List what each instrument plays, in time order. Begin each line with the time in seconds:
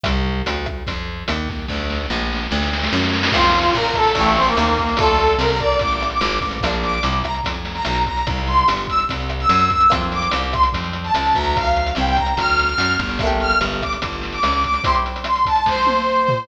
0.04 electric bass (finger) C2, kick, cross-stick, closed hi-hat
0.46 electric bass (finger) D2, closed hi-hat
0.66 kick, cross-stick
0.87 electric bass (finger) F2, kick, closed hi-hat
1.28 electric bass (finger) D#2, cross-stick, closed hi-hat
1.49 kick, snare
1.68 electric bass (finger) D2, kick, snare
1.90 snare
2.10 electric bass (finger) A#1, snare
2.33 snare
2.51 electric bass (finger) D2, snare
2.63 snare
2.73 snare
2.83 snare
2.93 electric bass (finger) F#2, snare
3.04 snare
3.14 snare
3.23 snare
3.32 electric bass (finger) F2, pizzicato strings A#3 C4, brass section F4, kick, cross-stick, crash
3.36 pizzicato strings F4
3.44 closed hi-hat
3.56 closed hi-hat
3.65 closed hi-hat
3.75 electric bass (finger) A#2, brass section A#4, closed hi-hat
3.85 closed hi-hat
3.94 brass section A4, kick, cross-stick, closed hi-hat
4.06 closed hi-hat
4.15 electric bass (finger) A1, pizzicato strings A3 D4, brass section A3, kick, closed hi-hat
4.19 pizzicato strings E4 G4
4.25 closed hi-hat
4.36 brass section C4, snare
4.47 brass section A#3, closed hi-hat
4.57 electric bass (finger) D#2, cross-stick, closed hi-hat
4.67 closed hi-hat
4.78 kick, closed hi-hat
4.89 closed hi-hat
4.97 electric bass (finger) D2, pizzicato strings A3 D4, brass section A4, kick, closed hi-hat
5.03 pizzicato strings F4
5.08 closed hi-hat
5.19 closed hi-hat
5.27 closed hi-hat
5.39 electric bass (finger) C2, brass section A#4, cross-stick, closed hi-hat
5.49 brass section A#4, closed hi-hat
5.60 brass section D5, kick, closed hi-hat
5.72 closed hi-hat
5.79 electric bass (finger) A1, brass section D6, kick, closed hi-hat
5.92 closed hi-hat
6.01 cross-stick, closed hi-hat
6.10 brass section D6, closed hi-hat
6.21 electric bass (finger) G#1, closed hi-hat
6.32 closed hi-hat
6.41 electric bass (finger) A1, kick, closed hi-hat
6.51 closed hi-hat
6.61 electric bass (finger) A#1, pizzicato strings A#3, kick, cross-stick, closed hi-hat
6.65 pizzicato strings D4 F4
6.73 closed hi-hat
6.83 brass section D6, closed hi-hat
6.93 closed hi-hat
7.03 electric bass (finger) C2, closed hi-hat
7.12 closed hi-hat
7.23 brass section A#5, kick, cross-stick, closed hi-hat
7.35 closed hi-hat
7.43 electric bass (finger) F2, kick, closed hi-hat
7.54 closed hi-hat
7.65 snare, closed hi-hat
7.75 brass section A#5, closed hi-hat
7.85 electric bass (finger) B1, cross-stick, closed hi-hat
7.95 closed hi-hat
8.06 brass section A#5, kick, closed hi-hat
8.17 closed hi-hat
8.27 electric bass (finger) C2, kick, closed hi-hat
8.38 closed hi-hat
8.47 brass section C6, closed hi-hat
8.57 closed hi-hat
8.68 electric bass (finger) G1, cross-stick, closed hi-hat
8.77 closed hi-hat
8.88 brass section E6, kick, closed hi-hat
8.99 closed hi-hat
9.09 electric bass (finger) C2, kick, closed hi-hat
9.20 closed hi-hat
9.29 cross-stick, closed hi-hat
9.40 brass section E6, closed hi-hat
9.49 electric bass (finger) F#2, closed hi-hat
9.59 closed hi-hat
9.70 brass section E6, kick, closed hi-hat
9.81 closed hi-hat
9.90 electric bass (finger) F2, pizzicato strings A#3 C4 F4, kick, cross-stick, closed hi-hat
10.01 closed hi-hat
10.12 brass section D6, closed hi-hat
10.22 closed hi-hat
10.31 electric bass (finger) C2, closed hi-hat
10.43 closed hi-hat
10.53 brass section C6, kick, cross-stick, closed hi-hat
10.63 closed hi-hat
10.72 electric bass (finger) F2, kick, closed hi-hat
10.84 closed hi-hat
10.93 closed hi-hat
11.04 brass section A5, closed hi-hat
11.14 electric bass (finger) C#2, cross-stick, closed hi-hat
11.26 closed hi-hat
11.35 electric bass (finger) D2, brass section A#5, kick, closed hi-hat
11.44 closed hi-hat
11.56 brass section F5, kick, closed hi-hat
11.64 closed hi-hat
11.76 closed hi-hat
11.86 closed hi-hat
11.95 electric bass (finger) C2, brass section G5, cross-stick, closed hi-hat
12.07 brass section G5, closed hi-hat
12.16 brass section A#5, kick, closed hi-hat
12.26 closed hi-hat
12.37 electric bass (finger) D2, brass section F6, kick, closed hi-hat
12.49 closed hi-hat
12.58 snare, closed hi-hat
12.68 brass section F6, closed hi-hat
12.78 electric bass (finger) F#2, closed hi-hat
12.90 closed hi-hat
12.99 electric bass (finger) G1, kick, closed hi-hat
13.09 closed hi-hat
13.19 pizzicato strings A3, kick, cross-stick, closed hi-hat
13.23 pizzicato strings A#3 D4 G4
13.29 closed hi-hat
13.40 brass section F6, closed hi-hat
13.50 closed hi-hat
13.61 electric bass (finger) G1, closed hi-hat
13.72 closed hi-hat
13.82 brass section D6, kick, cross-stick, closed hi-hat
13.93 closed hi-hat
14.02 electric bass (finger) G1, kick, closed hi-hat
14.13 closed hi-hat
14.22 snare, closed hi-hat
14.32 brass section D6, closed hi-hat
14.43 electric bass (finger) C#2, cross-stick, closed hi-hat
14.52 closed hi-hat
14.64 brass section D6, kick, closed hi-hat
14.74 closed hi-hat
14.84 pizzicato strings C4 E4 G4, brass section C6, kick, closed hi-hat
14.95 closed hi-hat
15.06 closed hi-hat
15.16 closed hi-hat
15.24 brass section C6, cross-stick, closed hi-hat
15.35 closed hi-hat
15.45 brass section A5, kick, closed hi-hat
15.56 closed hi-hat
15.66 brass section C5, kick, snare
15.87 high tom
16.28 floor tom